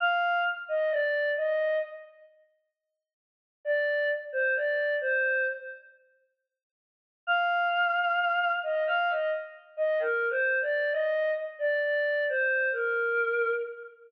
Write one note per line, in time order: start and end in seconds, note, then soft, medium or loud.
0.00 0.39 F5 loud
0.68 0.90 D#5 loud
0.90 1.29 D5 loud
1.36 1.77 D#5 loud
3.65 4.08 D5 loud
4.32 4.54 C5 medium
4.54 4.94 D5 medium
5.01 5.45 C5 loud
7.27 8.49 F5 loud
8.63 8.84 D#5 medium
8.86 9.08 F5 loud
9.09 9.30 D#5 medium
9.77 9.98 D#5 loud
9.99 10.28 A#4 loud
10.29 10.58 C5 loud
10.61 10.90 D5 loud
10.91 11.31 D#5 loud
11.59 11.80 D5 loud
11.81 12.23 D5 loud
12.29 12.68 C5 loud
12.72 13.52 A#4 medium